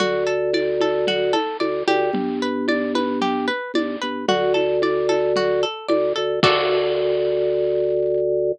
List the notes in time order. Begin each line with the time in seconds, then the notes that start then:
0.00 D2 F#4, low conga
0.27 A4
0.53 D5, high conga
0.80 A4, high conga
1.07 F#4, low conga
1.33 A4, high conga
1.60 D2 D5, high conga
1.88 D2 G4, high conga
2.13 G1, low conga
2.42 B4
2.68 D5, high conga
2.95 B4, high conga
3.21 G4, low conga
3.48 B4
3.74 G1 D5, high conga
4.02 G1 B4
4.28 D2 F#4, low conga
4.54 A4, high conga
4.82 D5, high conga
5.09 A4, high conga
5.36 F#4, low conga
5.63 A4
5.89 D2 D5, high conga
6.16 D2 A4
6.43 D2 F#4 A4 D5, kick, crash